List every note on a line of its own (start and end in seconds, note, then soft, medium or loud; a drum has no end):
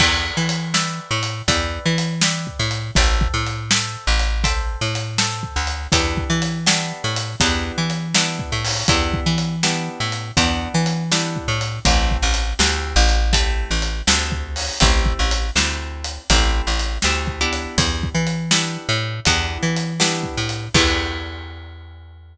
0.00 0.31 E2 loud
0.00 0.66 B4 loud
0.00 0.66 D5 medium
0.00 0.66 E5 medium
0.00 0.66 G5 medium
0.00 kick medium
0.00 crash loud
0.37 1.00 E3 medium
0.49 closed hi-hat medium
0.74 1.41 B4 medium
0.74 1.41 D5 medium
0.74 1.41 E5 medium
0.74 1.41 G5 medium
0.74 snare loud
1.11 1.42 A2 medium
1.23 closed hi-hat medium
1.48 1.79 E2 loud
1.48 2.15 B4 loud
1.48 2.15 D5 medium
1.48 2.15 E5 medium
1.48 2.15 G5 medium
1.48 kick medium
1.48 closed hi-hat medium
1.85 2.48 E3 loud
1.98 closed hi-hat medium
2.21 2.89 B4 medium
2.21 2.89 D5 medium
2.21 2.89 E5 medium
2.21 2.89 G5 medium
2.21 snare loud
2.47 kick medium
2.59 2.91 A2 loud
2.71 closed hi-hat medium
2.95 3.28 A1 loud
2.95 3.63 A4 loud
2.95 3.63 C5 loud
2.95 3.63 E5 medium
2.95 3.63 G5 loud
2.95 kick loud
2.95 closed hi-hat loud
3.21 kick medium
3.34 3.97 A2 medium
3.46 closed hi-hat medium
3.71 4.38 A4 medium
3.71 4.38 C5 medium
3.71 4.38 E5 medium
3.71 4.38 G5 medium
3.71 snare loud
4.07 4.76 A1 loud
4.19 closed hi-hat medium
4.44 5.11 A4 medium
4.44 5.11 C5 loud
4.44 5.11 E5 loud
4.44 5.11 G5 medium
4.44 kick medium
4.44 closed hi-hat medium
4.81 5.44 A2 medium
4.95 closed hi-hat medium
5.18 5.85 A4 medium
5.18 5.85 C5 medium
5.18 5.85 E5 medium
5.18 5.85 G5 medium
5.18 snare loud
5.43 kick medium
5.56 5.88 D2 medium
5.67 closed hi-hat medium
5.92 6.24 E2 loud
5.92 6.59 B3 medium
5.92 6.59 D4 medium
5.92 6.59 E4 medium
5.92 6.59 G4 medium
5.92 kick loud
5.92 closed hi-hat loud
6.17 kick medium
6.30 6.93 E3 loud
6.42 closed hi-hat medium
6.66 7.33 B3 medium
6.66 7.33 D4 medium
6.66 7.33 E4 medium
6.66 7.33 G4 medium
6.66 snare loud
7.04 7.35 A2 medium
7.16 closed hi-hat medium
7.40 7.72 E2 loud
7.40 8.08 B3 medium
7.40 8.08 D4 medium
7.40 8.08 E4 medium
7.40 8.08 G4 medium
7.40 kick medium
7.40 closed hi-hat loud
7.78 8.41 E3 medium
7.90 closed hi-hat medium
8.15 8.82 B3 medium
8.15 8.82 D4 medium
8.15 8.82 E4 medium
8.15 8.82 G4 medium
8.15 snare loud
8.39 kick medium
8.52 8.83 A2 medium
8.65 open hi-hat medium
8.88 9.20 E2 medium
8.88 9.56 B3 medium
8.88 9.56 D4 medium
8.88 9.56 E4 loud
8.88 9.56 G4 medium
8.88 kick loud
8.88 closed hi-hat loud
9.14 kick medium
9.26 9.89 E3 medium
9.38 closed hi-hat medium
9.63 10.30 B3 medium
9.63 10.30 D4 medium
9.63 10.30 E4 medium
9.63 10.30 G4 medium
9.63 snare medium
10.00 10.32 A2 medium
10.12 closed hi-hat medium
10.37 10.68 E2 loud
10.37 11.04 B3 loud
10.37 11.04 D4 medium
10.37 11.04 E4 medium
10.37 11.04 G4 medium
10.37 kick medium
10.37 closed hi-hat medium
10.74 11.37 E3 medium
10.86 closed hi-hat medium
11.12 11.78 B3 medium
11.12 11.78 D4 medium
11.12 11.78 E4 medium
11.12 11.78 G4 medium
11.12 snare loud
11.36 kick medium
11.48 11.79 A2 medium
11.61 closed hi-hat medium
11.85 12.17 A1 loud
11.85 12.52 A3 medium
11.85 12.52 C4 medium
11.85 12.52 E4 medium
11.85 12.52 G4 medium
11.85 kick loud
11.85 closed hi-hat loud
12.11 kick medium
12.22 12.54 A1 loud
12.34 closed hi-hat medium
12.59 12.94 D2 loud
12.59 13.26 A3 medium
12.59 13.26 C4 medium
12.59 13.26 E4 medium
12.59 13.26 G4 medium
12.59 snare loud
12.96 13.64 A1 loud
13.09 closed hi-hat medium
13.33 14.00 A3 medium
13.33 14.00 C4 medium
13.33 14.00 E4 loud
13.33 14.00 G4 medium
13.33 kick medium
13.33 closed hi-hat loud
13.71 14.02 A1 medium
13.82 closed hi-hat medium
14.07 14.70 D2 loud
14.07 14.74 A3 medium
14.07 14.74 C4 medium
14.07 14.74 E4 medium
14.07 14.74 G4 medium
14.07 snare loud
14.32 kick medium
14.56 open hi-hat medium
14.80 15.13 A1 loud
14.80 15.47 A3 medium
14.80 15.47 C4 medium
14.80 15.47 E4 loud
14.80 15.47 G4 medium
14.80 kick loud
14.80 closed hi-hat loud
15.06 kick medium
15.19 15.50 A1 medium
15.31 closed hi-hat medium
15.56 16.18 D2 medium
15.56 16.23 A3 medium
15.56 16.23 C4 medium
15.56 16.23 E4 medium
15.56 16.23 G4 medium
15.56 snare loud
16.04 closed hi-hat medium
16.30 16.61 A1 loud
16.30 16.97 A3 loud
16.30 16.97 C4 medium
16.30 16.97 E4 medium
16.30 16.97 G4 medium
16.30 kick medium
16.30 closed hi-hat loud
16.67 16.98 A1 medium
16.79 closed hi-hat medium
17.02 17.67 D2 medium
17.02 17.39 A3 medium
17.02 17.39 C4 medium
17.02 17.39 E4 medium
17.02 17.39 G4 medium
17.02 snare medium
17.27 kick medium
17.41 18.45 B3 medium
17.41 18.45 D4 medium
17.41 18.45 E4 medium
17.41 18.45 G4 medium
17.53 closed hi-hat medium
17.78 18.09 E2 loud
17.78 kick loud
17.78 closed hi-hat loud
18.03 kick medium
18.15 18.77 E3 medium
18.27 closed hi-hat medium
18.51 19.18 B3 medium
18.51 19.18 D4 medium
18.51 19.18 E4 medium
18.51 19.18 G4 medium
18.51 snare loud
18.89 19.20 A2 loud
19.25 19.58 E2 loud
19.25 19.93 B3 loud
19.25 19.93 D4 medium
19.25 19.93 E4 medium
19.25 19.93 G4 medium
19.25 kick medium
19.25 closed hi-hat medium
19.63 20.25 E3 medium
19.76 closed hi-hat medium
20.00 20.66 B3 medium
20.00 20.66 D4 medium
20.00 20.66 E4 medium
20.00 20.66 G4 medium
20.00 snare loud
20.23 kick medium
20.37 20.69 A2 medium
20.49 closed hi-hat medium
20.74 22.37 E2 loud
20.74 22.37 B3 loud
20.74 22.37 D4 loud
20.74 22.37 E4 loud
20.74 22.37 G4 loud
20.74 kick loud
20.74 crash loud